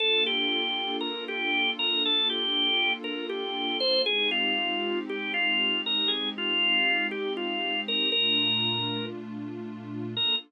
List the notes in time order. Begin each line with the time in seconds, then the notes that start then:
0.00 A#3 D4 F4 A4
0.26 G4
1.01 A#4
1.28 G4
1.79 A#4
2.05 A4
2.30 G4
3.04 A#4
3.29 G4
3.80 C5
4.06 G#3 C4 D#4 G4 G#4
4.31 F4
5.09 G4
5.34 F4
5.86 A#4
6.08 G#4
6.38 F4
7.11 G4
7.37 F4
7.88 A#4
8.12 A#2 A3 D4 F4 A#4
10.17 A#3 D4 F4 A4 A#4